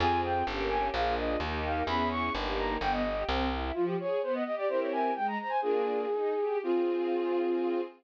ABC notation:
X:1
M:2/4
L:1/16
Q:1/4=128
K:Fm
V:1 name="Flute"
a2 g2 z2 a2 | f2 e2 z2 f2 | _c'2 d'2 z2 b2 | g e3 z4 |
F G d2 c e e =d | c d a2 g b b a | "^rit." A8 | F8 |]
V:2 name="String Ensemble 1"
[CFA]4 [B,DG]4 | [B,=DFA]4 [B,EG]4 | [_CD_FA]4 [B,EG]4 | =B,2 G2 C2 =E2 |
F,2 A2 =B,2 G2 | [C=EGB]4 A,2 c2 | "^rit." [B,=DFA]4 E2 G2 | [CFA]8 |]
V:3 name="Electric Bass (finger)" clef=bass
F,,4 G,,,4 | B,,,4 E,,4 | _F,,4 G,,,4 | G,,,4 C,,4 |
z8 | z8 | "^rit." z8 | z8 |]